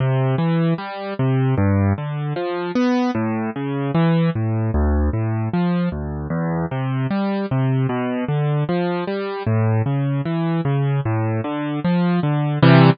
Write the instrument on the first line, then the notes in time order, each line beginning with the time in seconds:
acoustic grand piano
0.00 C3
0.38 E3
0.78 G3
1.19 C3
1.58 G2
1.98 D3
2.36 F3
2.75 B3
3.15 A2
3.56 C#3
3.95 E3
4.35 A2
4.74 D2
5.13 A2
5.53 F3
5.92 D2
6.30 E2
6.71 C3
7.11 G3
7.51 C3
7.89 B2
8.28 D3
8.69 F3
9.07 G3
9.47 A2
9.86 C#3
10.25 E3
10.65 C#3
11.05 A2
11.44 D3
11.85 F3
12.23 D3
12.63 C3 E3 G3